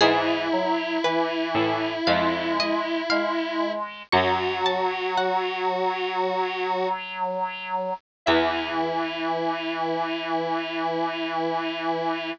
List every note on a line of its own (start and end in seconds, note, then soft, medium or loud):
0.01 1.36 G#2 medium
0.01 0.47 E3 loud
0.01 3.72 E4 loud
0.01 0.94 G#4 loud
0.52 0.98 F#3 medium
1.04 1.93 E3 medium
1.04 1.92 B4 loud
1.55 2.00 A2 medium
2.07 3.74 F2 medium
2.07 3.02 G#3 medium
2.07 2.52 F5 loud
2.60 3.05 D#5 loud
3.10 4.02 G#3 medium
3.10 3.96 F5 loud
4.13 6.56 F#2 medium
4.13 7.93 F#3 loud
4.13 6.88 F#4 loud
4.13 4.58 C#6 loud
4.66 5.12 A5 loud
5.17 7.06 F#5 medium
8.26 12.32 E2 loud
8.26 12.32 E3 loud
8.26 12.30 E4 loud
8.26 12.31 E5 loud